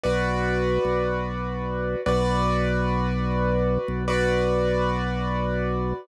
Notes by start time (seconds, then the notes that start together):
0.04 B1 F#4 B4 D5
0.85 B1
2.06 B1 F#4 B4 D5
3.88 B1
4.08 F#4 B4 D5